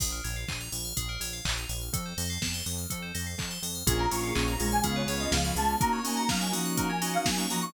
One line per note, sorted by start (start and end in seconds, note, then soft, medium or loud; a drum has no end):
0.00 0.21 A#1 medium
0.00 0.11 G#4 medium
0.00 kick medium
0.00 crash loud
0.12 0.23 A#4 medium
0.24 0.45 A#1 medium
0.24 0.35 C#5 medium
0.24 open hi-hat medium
0.36 0.47 F5 medium
0.48 0.69 A#1 medium
0.48 0.59 G#5 medium
0.48 kick medium
0.48 clap medium
0.60 0.71 A#5 medium
0.72 0.93 A#1 medium
0.72 0.83 C#6 medium
0.72 open hi-hat medium
0.85 0.96 F6 medium
0.97 1.18 A#1 medium
0.97 1.08 G#4 medium
0.97 kick medium
0.97 closed hi-hat medium
1.09 1.20 A#4 medium
1.20 1.41 A#1 medium
1.20 1.32 C#5 medium
1.20 open hi-hat medium
1.33 1.44 F5 medium
1.45 1.66 A#1 medium
1.45 1.56 G#5 medium
1.45 kick medium
1.45 clap loud
1.57 1.68 A#5 medium
1.69 1.90 A#1 medium
1.69 1.80 C#6 medium
1.69 open hi-hat medium
1.81 1.92 F6 medium
1.93 2.13 F2 medium
1.93 2.04 A4 medium
1.93 kick medium
1.93 closed hi-hat medium
2.06 2.17 C5 medium
2.17 2.38 F2 medium
2.17 2.29 D#5 medium
2.17 open hi-hat medium
2.30 2.41 F5 medium
2.42 2.62 F2 medium
2.42 2.53 A5 medium
2.42 kick medium
2.42 snare medium
2.54 2.65 C6 medium
2.66 2.86 F2 medium
2.66 2.77 D#6 medium
2.66 open hi-hat medium
2.78 2.89 F6 medium
2.90 3.12 F2 medium
2.90 3.01 A4 medium
2.90 kick medium
2.90 closed hi-hat medium
3.02 3.13 C5 medium
3.15 3.35 F2 medium
3.15 3.25 D#5 medium
3.15 open hi-hat medium
3.27 3.38 F5 medium
3.38 3.58 F2 medium
3.38 3.50 A5 medium
3.38 kick medium
3.38 clap medium
3.51 3.62 C6 medium
3.62 3.83 F2 medium
3.62 3.74 D#6 medium
3.62 open hi-hat medium
3.75 3.86 F6 medium
3.87 4.07 A#1 medium
3.87 4.06 A#3 medium
3.87 4.83 A#3 medium
3.87 4.06 C#4 medium
3.87 4.83 C#4 medium
3.87 4.08 F4 loud
3.87 4.06 F4 loud
3.87 4.83 F4 medium
3.87 4.06 G#4 loud
3.87 3.98 G#4 loud
3.87 4.83 G#4 medium
3.87 3.99 G#5 medium
3.87 kick loud
3.87 closed hi-hat loud
3.99 4.10 A#4 medium
3.99 4.11 A#5 loud
4.10 4.32 A#1 medium
4.10 4.31 A#3 medium
4.10 4.31 C#4 medium
4.10 4.32 F4 medium
4.10 4.31 F4 medium
4.10 4.31 G#4 medium
4.10 4.22 C#5 medium
4.10 4.23 C#6 loud
4.10 open hi-hat medium
4.23 4.34 F5 medium
4.23 4.35 C#6 medium
4.35 4.57 A#1 medium
4.35 4.55 A#3 medium
4.35 4.55 C#4 medium
4.35 4.55 F4 medium
4.35 4.55 G#4 medium
4.35 4.46 G#5 medium
4.35 4.47 C#6 medium
4.35 kick medium
4.35 clap loud
4.48 4.58 A#5 medium
4.48 4.68 A#5 medium
4.59 4.81 A#1 medium
4.59 5.24 G#3 loud
4.59 4.80 A#3 medium
4.59 4.80 C#4 medium
4.59 4.80 F4 medium
4.59 4.80 G#4 medium
4.59 4.71 C#6 medium
4.59 open hi-hat medium
4.71 4.83 G#5 medium
4.71 4.83 F6 medium
4.83 5.05 C#2 loud
4.83 5.03 B3 medium
4.83 5.80 B3 medium
4.83 5.03 C#4 medium
4.83 5.80 C#4 medium
4.83 5.03 F4 medium
4.83 5.80 F4 medium
4.83 5.03 G#4 medium
4.83 4.95 G#4 loud
4.83 5.80 G#4 medium
4.83 4.96 F5 medium
4.83 kick medium
4.83 closed hi-hat loud
4.96 5.07 B4 medium
4.96 5.16 C#5 medium
5.07 5.27 C#2 medium
5.07 5.38 B3 medium
5.07 5.38 C#4 medium
5.07 5.38 F4 medium
5.07 5.38 G#4 medium
5.07 5.19 C#5 medium
5.07 open hi-hat medium
5.20 5.32 D#5 loud
5.20 5.31 F5 medium
5.32 5.52 C#2 medium
5.32 5.55 F3 medium
5.32 5.53 F5 medium
5.32 5.43 G#5 medium
5.32 kick medium
5.32 snare loud
5.44 5.55 B3 medium
5.44 5.55 C#4 medium
5.44 5.55 F4 medium
5.44 5.55 G#4 medium
5.44 5.55 B5 medium
5.55 5.76 C#2 medium
5.55 5.77 G#3 medium
5.55 5.76 B3 medium
5.55 5.76 C#4 medium
5.55 5.76 F4 medium
5.55 5.76 G#4 medium
5.55 5.77 A5 medium
5.55 5.67 C#6 medium
5.55 open hi-hat medium
5.69 5.79 F6 medium
5.80 7.72 A#3 medium
5.80 6.01 A#3 loud
5.80 6.00 A#3 medium
5.80 7.72 C#4 medium
5.80 6.00 C#4 medium
5.80 7.72 D#4 medium
5.80 6.00 D#4 medium
5.80 7.72 F#4 medium
5.80 6.00 F#4 medium
5.80 5.92 A#4 loud
5.80 5.92 A#5 loud
5.80 kick loud
5.80 closed hi-hat loud
5.93 6.04 C#5 medium
5.93 6.04 C#6 medium
6.04 6.23 A#3 medium
6.04 6.28 A#3 loud
6.04 6.23 C#4 medium
6.04 6.23 D#4 medium
6.04 6.23 F#4 medium
6.04 6.16 D#5 medium
6.04 6.17 G#5 medium
6.04 open hi-hat medium
6.17 6.28 F#5 medium
6.17 6.28 A#5 medium
6.29 6.52 F#3 loud
6.29 6.48 A#3 medium
6.29 6.48 C#4 medium
6.29 6.48 D#4 medium
6.29 6.48 F#4 medium
6.29 6.40 F5 loud
6.29 6.40 A#5 medium
6.29 kick medium
6.29 snare loud
6.41 6.52 G#5 medium
6.41 6.52 C#6 medium
6.52 7.17 F3 medium
6.52 6.91 A#3 medium
6.52 6.91 C#4 medium
6.52 6.91 D#4 medium
6.52 6.91 F#4 medium
6.52 6.64 D#6 medium
6.52 open hi-hat medium
6.65 6.76 F#6 medium
6.77 6.88 A#4 loud
6.77 6.89 A#5 loud
6.77 kick medium
6.77 closed hi-hat medium
6.90 7.00 C#5 medium
6.90 7.13 G#5 medium
7.02 7.31 A#3 medium
7.02 7.31 C#4 medium
7.02 7.31 D#4 medium
7.02 7.31 F#4 medium
7.02 7.13 D#5 medium
7.02 open hi-hat medium
7.14 7.25 F5 medium
7.14 7.25 F#5 medium
7.25 7.46 F#3 medium
7.25 7.38 G#5 medium
7.25 7.37 A#5 medium
7.25 kick medium
7.25 snare loud
7.37 7.47 A#3 medium
7.37 7.47 C#4 medium
7.37 7.47 D#4 medium
7.37 7.47 F#4 medium
7.37 7.49 C#6 medium
7.50 7.72 F3 medium
7.50 7.70 A#3 medium
7.50 7.70 C#4 medium
7.50 7.70 D#4 medium
7.50 7.70 F#4 medium
7.50 7.62 A#5 loud
7.50 7.61 D#6 medium
7.50 open hi-hat medium
7.62 7.73 C#6 loud
7.62 7.73 F#6 medium